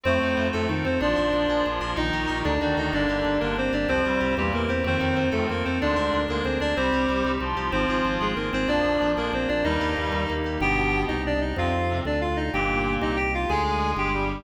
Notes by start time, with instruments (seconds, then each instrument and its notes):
0.03 drawbar organ F2, clarinet A2 A3 C4 C5, electric piano 2 C4
0.22 drawbar organ F2, electric piano 2 D#4
0.37 drawbar organ F2, electric piano 2 F4
0.53 drawbar organ F2, clarinet A2 A3 A4, electric piano 2 A4
0.68 drawbar organ F2, clarinet D#3 D#4, electric piano 2 C4
0.84 drawbar organ F2, clarinet C4 C5, electric piano 2 D#4
1.00 drawbar organ A#1, clarinet F3 D4 F4 D5, electric piano 2 D4
1.16 drawbar organ A#1, electric piano 2 A#4
1.33 drawbar organ A#1, electric piano 2 D4
1.49 drawbar organ A#1, electric piano 2 G#4
1.65 drawbar organ A#1, clarinet F3 F4, electric piano 2 D4
1.81 drawbar organ A#1, electric piano 2 A#4
1.96 drawbar organ A#1, clarinet D#3 D#4 D#5, electric piano 2 D#4
2.13 drawbar organ A#1, electric piano 2 G4
2.27 drawbar organ A#1, electric piano 2 A#4
2.44 drawbar organ D2, clarinet D4 D5, electric piano 2 D4
2.61 drawbar organ D2, clarinet D#3 D4 D#4 D5, electric piano 2 F#4
2.77 drawbar organ D2, clarinet D#4 D#5, electric piano 2 A4
2.93 drawbar organ G1, clarinet D3 D4 D5, electric piano 2 A#3
3.09 drawbar organ G1, electric piano 2 G4
3.25 drawbar organ G1, electric piano 2 A#3
3.40 drawbar organ G1, clarinet D3 A#3 D4 A#4, electric piano 2 D4
3.56 drawbar organ G1, electric piano 2 A#3, clarinet C4 C5
3.72 drawbar organ G1, clarinet D4 D5, electric piano 2 G4
3.88 drawbar organ C2, clarinet F2 F3 C4 C5, electric piano 2 C4
4.05 drawbar organ C2, clarinet G2 G3, electric piano 2 F4
4.20 drawbar organ C2, electric piano 2 G4
4.37 drawbar organ E2, clarinet A#2 G3 A#3 G4, electric piano 2 C4
4.52 drawbar organ E2, clarinet A#3 A#4, electric piano 2 E4
4.68 drawbar organ E2, clarinet C4 C5, electric piano 2 G4
4.84 clarinet D#2 D#3 C4 C5, drawbar organ F2, electric piano 2 C4
5.00 drawbar organ F2, electric piano 2 D#4
5.16 drawbar organ F2, electric piano 2 F4
5.31 clarinet D#2 D#3 A3 A4, drawbar organ F2, electric piano 2 A4
5.49 drawbar organ F2, clarinet A#3 A#4, electric piano 2 C4
5.65 drawbar organ F2, clarinet C4 C5, electric piano 2 D#4
5.81 drawbar organ D2, clarinet G#2 G#3 D4 D5, electric piano 2 D4
5.96 drawbar organ D2, electric piano 2 A#4
6.13 drawbar organ D2, electric piano 2 D4
6.29 drawbar organ D2, clarinet G#2 G#3 A#3 A#4, electric piano 2 G#4
6.44 drawbar organ D2, clarinet C4 C5, electric piano 2 D4
6.60 drawbar organ D2, clarinet D4 D5, electric piano 2 A#4
6.76 drawbar organ C2, clarinet G3 C4 G4 C5, electric piano 2 C4
6.93 drawbar organ C2, electric piano 2 G4
7.09 drawbar organ C2, electric piano 2 C4
7.25 drawbar organ C2, electric piano 2 D#4
7.40 drawbar organ C2, clarinet F3 F4, electric piano 2 C4
7.57 drawbar organ C2, electric piano 2 G4
7.72 drawbar organ G#1, clarinet F3 C4 F4 C5, electric piano 2 C4
7.89 drawbar organ G#1, electric piano 2 G#4
8.05 drawbar organ G#1, electric piano 2 C4
8.21 drawbar organ G#1, clarinet G#3 G#4, electric piano 2 F4
8.36 drawbar organ G#1, clarinet A#3 A#4, electric piano 2 C4
8.53 drawbar organ G#1, clarinet C4 C5, electric piano 2 G#4
8.67 drawbar organ A#1, clarinet F2 F3 D4 D5, electric piano 2 A#3
8.84 drawbar organ A#1, electric piano 2 D4
9.01 drawbar organ A#1, electric piano 2 F4
9.17 drawbar organ A#1, clarinet F2 F3 A#3 A#4, electric piano 2 G#4
9.33 drawbar organ A#1, electric piano 2 A#3, clarinet C4 C5
9.48 drawbar organ A#1, clarinet D4 D5, electric piano 2 D4
9.64 drawbar organ D#2, clarinet G2 G3 D#4 D#5, electric piano 2 A#3
9.81 drawbar organ D#2, electric piano 2 G4
9.97 drawbar organ D#2, electric piano 2 A#3
10.12 drawbar organ D#2, electric piano 2 D#4
10.28 drawbar organ D#2, electric piano 2 A#3
10.44 drawbar organ D#2, electric piano 2 G4
10.60 drawbar organ G1, clarinet B2 B3 G4 G5
11.08 drawbar organ C2, clarinet D#4 D#5
11.26 clarinet D4 D5
11.41 clarinet D#4 D#5
11.56 drawbar organ F2, clarinet C3 C4 F4 F5
11.89 clarinet C3 C4
12.05 drawbar organ D2, clarinet D4 D5
12.21 clarinet F4 F5
12.36 clarinet D#4 D#5
12.53 drawbar organ G1, clarinet A#2 A#3 G4 G5
13.01 drawbar organ C2, clarinet D#4 D#5
13.16 clarinet G4 G5
13.34 clarinet F4 F5
13.49 drawbar organ D2, clarinet G#3 G#4 G#5
13.97 drawbar organ G1, clarinet G4 G5
14.13 clarinet G3 G4